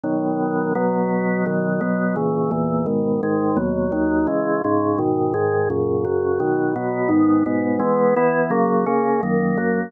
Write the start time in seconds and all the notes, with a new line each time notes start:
0.04 B2 D#3 F#3
0.75 B2 F#3 B3
1.46 B2 D#3 F#3
1.81 B2 F#3 B3
2.16 A#2 C#3 E3
2.51 E2 A#2 E3
2.86 G#2 B2 D#3
3.23 G#2 D#3 G#3
3.57 D#2 B2 F#3
3.92 D#2 D#3 F#3
4.27 C#3 E3 G#3
4.64 G#2 C#3 G#3
4.98 G#2 B2 D#3
5.34 G#2 D#3 G#3
5.70 F#2 A#2 C#3
6.05 F#2 C#3 F#3
6.40 B2 D#3 F#3
6.76 B2 F#3 B3
7.09 G#2 D#3 B3
7.46 G#2 B2 B3
7.79 E3 G#3 B3
8.16 E3 B3 E4
8.50 C#3 F#3 A#3
8.86 C#3 A#3 C#4
9.23 F#2 D#3 A#3
9.57 F#2 F#3 A#3